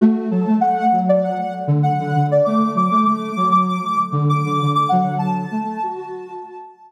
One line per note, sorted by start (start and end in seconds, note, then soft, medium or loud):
0.01 0.29 A3 loud
0.01 0.27 F#4 medium
0.30 0.45 F#3 loud
0.30 0.56 A4 medium
0.46 0.60 A3 medium
0.60 0.87 A3 loud
0.60 0.99 F#5 medium
0.92 1.35 F#3 medium
1.09 1.23 D5 medium
1.24 1.38 F#5 medium
1.39 1.53 F#5 medium
1.67 1.93 D3 loud
1.83 2.26 F#5 medium
1.99 2.14 D3 loud
2.14 2.41 D3 loud
2.31 2.46 D5 medium
2.45 2.75 A3 loud
2.45 2.71 D6 medium
2.75 2.89 F#3 medium
2.75 3.04 D6 medium
2.91 3.05 A3 loud
3.05 3.31 A3 loud
3.05 3.49 D6 medium
3.36 3.79 F#3 loud
3.51 3.66 D6 medium
3.68 3.83 D6 medium
3.85 3.99 D6 medium
4.12 4.42 D3 loud
4.29 4.70 D6 medium
4.45 4.59 D3 loud
4.61 4.87 D3 loud
4.75 4.89 D6 medium
4.89 5.46 D3 loud
4.89 5.46 F#3 loud
4.89 5.15 F#5 medium
5.18 6.92 A5 medium
5.51 5.64 A3 loud
5.64 5.79 A3 loud
5.83 5.96 F#4 loud
5.96 6.64 F#4 loud